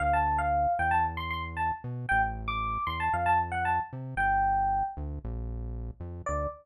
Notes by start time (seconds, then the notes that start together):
0.00 D2 F5
0.13 A5
0.38 F5
0.79 E2 G5
0.91 A5
1.17 C6
1.31 C6
1.57 A5
1.84 B2
2.09 A1 G5
2.48 D6
2.87 E2 C6
3.00 A5
3.13 F2 F5
3.26 A5
3.52 F#5
3.65 A5
3.93 C3
4.16 G1 G5
4.97 D2
5.24 A#1
6.00 F2
6.26 D2 D5